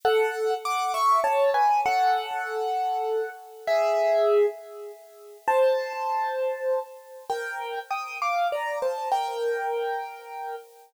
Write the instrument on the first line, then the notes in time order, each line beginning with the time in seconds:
acoustic grand piano
0.05 A4 F#5
0.65 F#5 D6
0.94 E5 C#6
1.24 C#5 A5
1.54 B4 G#5
1.86 A4 F#5
3.67 G#4 E5
5.48 C5 A5
7.30 A#4 G5
7.91 G5 D#6
8.22 F5 D6
8.52 D5 A#5
8.82 C5 A5
9.12 A#4 G5